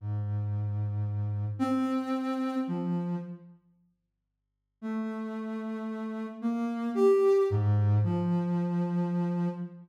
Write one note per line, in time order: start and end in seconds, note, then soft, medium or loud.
0.01 1.45 G#2 medium
1.59 2.55 C4 loud
2.67 3.16 F3 medium
4.81 6.26 A3 medium
6.42 6.90 A#3 medium
6.95 7.43 G4 medium
7.50 7.98 G#2 medium
8.03 9.48 F3 medium